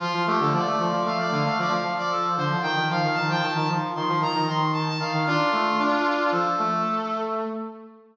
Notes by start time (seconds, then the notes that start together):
0.00 F3 F4
0.13 F3
0.26 A3 G4
0.39 D3 A4
0.52 F3 D5
0.66 A3
0.79 F3
0.92 F3
1.05 A3 F5
1.18 D5
1.31 D3 F5
1.45 A3 F5
1.58 F3 D5
1.70 F3 F5
1.83 F3
1.98 D5
2.10 A4
2.37 D3 C5
2.50 F3
2.62 D#3 G5
2.76 D#3
2.90 F3 F5
3.03 D#3
3.14 D#3 A5
3.28 F3 G5
3.42 D#3 A5
3.55 D#3 A5
3.69 F3
3.95 D#3 C6
4.08 F3
4.20 D#3 A#5
4.34 D#3
4.47 D#3 C6
4.73 A5
4.88 A5
4.99 D#3 F5
5.13 D#3
5.27 D4 F4
5.52 A3
5.79 D4
6.31 F3 A4
6.58 A3